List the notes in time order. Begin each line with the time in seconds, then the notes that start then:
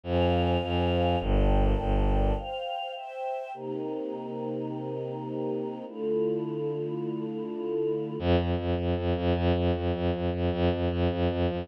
0.04 F2 C5 F5 G#5
0.63 F2
1.20 G1 A#4 D5 G5 A5
1.78 G1
2.36 C5 F5 G5
2.94 C5 E5 G5
3.54 C3 A#3 D#4 G4
5.86 D3 A3 E4 F4
8.19 F2
8.39 F2
8.58 F2
8.78 F2
8.97 F2
9.16 F2
9.35 F2
9.55 F2
9.75 F2
9.94 F2
10.13 F2
10.33 F2
10.52 F2
10.72 F2
10.91 F2
11.11 F2
11.30 F2
11.50 F2